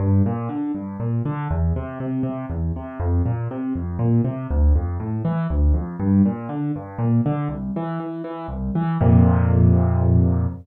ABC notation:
X:1
M:6/8
L:1/8
Q:3/8=80
K:F
V:1 name="Acoustic Grand Piano" clef=bass
G,, B,, D, G,, B,, D, | E,, C, C, C, E,, C, | F,, B,, C, F,, B,, C, | D,, F,, A,, E, D,, F,, |
G,, B,, D, G,, B,, D, | C,, E, E, E, C,, E, | [F,,B,,C,]6 |]